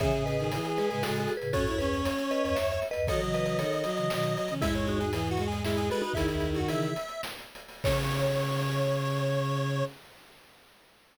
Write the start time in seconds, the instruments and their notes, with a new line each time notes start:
0.00 ocarina C#3 E3, violin C#3, lead 1 (square) G#4, vibraphone C#5 E5, kick, closed hi-hat
0.11 ocarina A2 C#3, closed hi-hat
0.25 violin C#3, vibraphone B4 D#5, closed hi-hat
0.39 violin D#3, closed hi-hat
0.52 violin E3, closed hi-hat
0.65 closed hi-hat
0.77 violin G#3, vibraphone G#4 B4, closed hi-hat
0.90 ocarina A2 C#3, violin G#3, vibraphone G#4 B4, closed hi-hat
1.03 ocarina A2 C#3, violin G#3, vibraphone F#4 A4, snare
1.15 violin G#3, closed hi-hat
1.20 vibraphone F#4 A4
1.28 closed hi-hat
1.37 ocarina A2 C#3, vibraphone G#4 B4
1.42 closed hi-hat
1.53 ocarina F#2 A2, violin C#4, vibraphone F#4 A4, lead 1 (square) C#5, kick, closed hi-hat
1.67 ocarina D#2 F#2, violin E4, closed hi-hat
1.78 violin C#4, vibraphone G#4 B4, closed hi-hat
1.94 closed hi-hat
2.05 closed hi-hat
2.18 closed hi-hat
2.31 vibraphone B4 D#5, closed hi-hat
2.43 ocarina D#2 F#2, vibraphone B4 D#5, closed hi-hat
2.55 ocarina D#2 F#2, vibraphone C#5 E5, snare
2.71 vibraphone C#5 E5, closed hi-hat
2.82 closed hi-hat
2.91 vibraphone B4 D#5, closed hi-hat
2.95 ocarina D#2 F#2
3.07 ocarina D#3 F#3, violin F#3, vibraphone A4 C#5, lead 1 (square) D#5, kick, closed hi-hat
3.20 ocarina C#3 E3, closed hi-hat
3.34 vibraphone B4 D#5, closed hi-hat
3.46 vibraphone B4 D#5, closed hi-hat
3.59 violin D#3, vibraphone A4 C#5, closed hi-hat
3.73 closed hi-hat
3.84 violin F#3, closed hi-hat
3.96 ocarina C#3 E3, closed hi-hat
4.10 ocarina B2 D#3, violin F#3, snare
4.23 closed hi-hat
4.36 violin F#3, closed hi-hat
4.48 ocarina C#3 E3, violin C#4, closed hi-hat
4.60 ocarina E2 G#2, violin G#3, vibraphone E4 G#4, lead 1 (square) E5, kick, closed hi-hat
4.74 lead 1 (square) C#5, closed hi-hat
4.87 vibraphone D#4 F#4, closed hi-hat
5.00 vibraphone D#4 F#4, lead 1 (square) G#4, closed hi-hat
5.13 violin E3, lead 1 (square) G#4, closed hi-hat
5.27 lead 1 (square) F#4, closed hi-hat
5.37 violin G#3, closed hi-hat
5.47 lead 1 (square) G#4
5.52 closed hi-hat
5.64 violin G#3, lead 1 (square) E4, vibraphone E4 G#4, snare
5.77 lead 1 (square) G#4, closed hi-hat
5.90 violin G#3, vibraphone F#4 A4, lead 1 (square) B4, closed hi-hat
6.02 vibraphone D#4 F#4, violin D#4, closed hi-hat
6.14 ocarina C#2 E2, violin D#3, lead 1 (square) E4, vibraphone E4 G#4, kick, closed hi-hat
6.28 ocarina C#2 E2, lead 1 (square) E4, closed hi-hat
6.40 closed hi-hat
6.53 ocarina D#2 F#2, lead 1 (square) F#4, closed hi-hat
6.68 ocarina C#3 E3, vibraphone E4 G#4, lead 1 (square) E5, closed hi-hat
6.82 closed hi-hat
6.96 closed hi-hat
7.08 closed hi-hat
7.23 snare
7.39 closed hi-hat
7.55 closed hi-hat
7.68 open hi-hat
7.83 ocarina C#3, violin C#3, vibraphone C#5, lead 1 (square) C#5, kick, crash